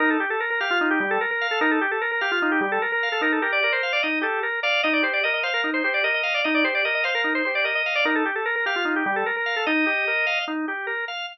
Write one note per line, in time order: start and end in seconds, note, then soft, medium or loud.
0.00 0.17 D#4 loud
0.00 0.10 A#4 medium
0.10 0.20 A4 medium
0.20 0.30 G4 medium
0.30 0.40 A4 medium
0.40 0.50 A#4 medium
0.50 0.60 A#4 medium
0.60 0.70 G4 medium
0.60 0.79 F5 medium
0.71 0.89 F4 medium
0.81 0.99 D#4 loud
0.91 1.00 G4 medium
1.00 1.18 G3 loud
1.00 1.10 G4 medium
1.11 1.20 A4 medium
1.21 1.30 A#4 medium
1.31 1.47 A#4 medium
1.41 1.59 F5 medium
1.51 1.61 A4 medium
1.61 1.79 D#4 loud
1.61 1.71 A#4 medium
1.71 1.81 A4 medium
1.81 1.91 G4 medium
1.91 2.01 A4 medium
2.01 2.11 A#4 medium
2.11 2.21 A#4 medium
2.21 2.31 G4 medium
2.21 2.39 F5 medium
2.32 2.51 F4 medium
2.42 2.60 D#4 loud
2.52 2.61 G4 medium
2.61 2.79 G3 medium
2.61 2.71 G4 medium
2.72 2.81 A4 medium
2.82 2.91 A#4 medium
2.92 3.09 A#4 medium
3.03 3.21 F5 medium
3.12 3.22 A4 medium
3.21 3.39 D#4 loud
3.21 3.32 A#4 medium
3.32 3.42 A4 medium
3.42 3.60 G4 medium
3.42 3.52 A#4 medium
3.52 3.62 D5 medium
3.62 3.82 A#4 loud
3.62 3.72 D5 medium
3.72 3.92 C5 medium
3.83 4.01 F5 medium
3.93 4.02 D5 medium
4.03 4.22 D#4 medium
4.03 4.19 D#5 medium
4.21 4.40 G4 loud
4.21 4.41 A4 medium
4.43 4.60 A#4 medium
4.63 4.81 D5 medium
4.63 4.82 F5 loud
4.83 5.02 D#4 loud
4.83 4.93 D#5 medium
4.93 5.03 D5 medium
5.03 5.21 G4 medium
5.03 5.13 C5 medium
5.13 5.23 D5 medium
5.23 5.43 A#4 loud
5.23 5.33 D#5 medium
5.34 5.43 D#5 medium
5.43 5.53 C5 medium
5.43 5.61 F5 loud
5.54 5.71 A#4 medium
5.64 5.82 D#4 medium
5.74 5.83 C5 medium
5.84 6.02 G4 medium
5.84 5.93 C5 medium
5.94 6.03 D5 medium
6.04 6.22 A#4 medium
6.04 6.14 D#5 medium
6.14 6.34 D#5 medium
6.23 6.41 F5 medium
6.34 6.44 D5 medium
6.44 6.63 D#4 loud
6.44 6.54 D#5 medium
6.54 6.64 D5 medium
6.64 6.82 G4 medium
6.64 6.74 C5 medium
6.75 6.84 D5 medium
6.85 7.03 A#4 medium
6.85 6.94 D#5 medium
6.95 7.04 D#5 medium
7.04 7.14 C5 medium
7.04 7.22 F5 medium
7.15 7.33 A#4 medium
7.24 7.42 D#4 medium
7.35 7.44 C5 medium
7.45 7.64 G4 medium
7.45 7.54 C5 medium
7.55 7.65 D5 medium
7.64 7.82 A#4 medium
7.64 7.75 D#5 medium
7.75 7.94 D#5 medium
7.86 8.04 F5 medium
7.95 8.05 D5 medium
8.05 8.23 D#4 loud
8.05 8.15 A#4 medium
8.15 8.25 A4 medium
8.25 8.35 G4 medium
8.35 8.45 A4 medium
8.46 8.55 A#4 medium
8.56 8.65 A#4 medium
8.66 8.75 G4 medium
8.66 8.85 F5 medium
8.76 8.94 F4 medium
8.85 9.03 D#4 medium
8.96 9.05 G4 medium
9.06 9.24 G3 medium
9.06 9.16 G4 medium
9.16 9.26 A4 medium
9.26 9.36 A#4 medium
9.36 9.55 A#4 medium
9.46 9.64 F5 medium
9.56 9.66 A4 medium
9.66 9.85 D#4 loud
9.66 10.39 D#5 medium
9.86 10.05 G4 loud
10.07 10.26 A#4 medium
10.27 10.45 F5 loud
10.48 10.66 D#4 loud
10.68 10.86 G4 medium
10.87 11.05 A#4 loud
11.08 11.26 F5 medium